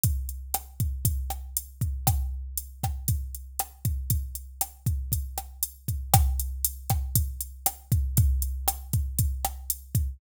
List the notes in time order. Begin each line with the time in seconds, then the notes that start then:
0.03 kick, closed hi-hat
0.29 closed hi-hat
0.54 cross-stick, closed hi-hat
0.80 kick, closed hi-hat
1.05 kick, closed hi-hat
1.30 cross-stick, closed hi-hat
1.57 closed hi-hat
1.81 kick, closed hi-hat
2.07 kick, cross-stick, closed hi-hat
2.58 closed hi-hat
2.83 kick, cross-stick, closed hi-hat
3.08 kick, closed hi-hat
3.35 closed hi-hat
3.59 cross-stick, closed hi-hat
3.85 kick, closed hi-hat
4.10 kick, closed hi-hat
4.35 closed hi-hat
4.61 cross-stick, closed hi-hat
4.86 kick, closed hi-hat
5.12 kick, closed hi-hat
5.38 cross-stick, closed hi-hat
5.63 closed hi-hat
5.88 kick, closed hi-hat
6.14 kick, cross-stick, closed hi-hat
6.40 closed hi-hat
6.65 closed hi-hat
6.90 kick, cross-stick, closed hi-hat
7.15 kick, closed hi-hat
7.41 closed hi-hat
7.66 cross-stick, closed hi-hat
7.92 kick, closed hi-hat
8.17 kick, closed hi-hat
8.42 closed hi-hat
8.68 cross-stick, closed hi-hat
8.93 kick, closed hi-hat
9.19 kick, closed hi-hat
9.45 cross-stick, closed hi-hat
9.70 closed hi-hat
9.95 kick, closed hi-hat